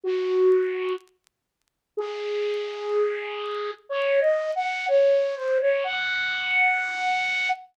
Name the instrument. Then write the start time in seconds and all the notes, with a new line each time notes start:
flute
0.03 F#4
1.97 G#4
3.89 C#5
4.20 D#5
4.55 F#5
4.88 C#5
5.35 C5
5.61 C#5
5.84 F#5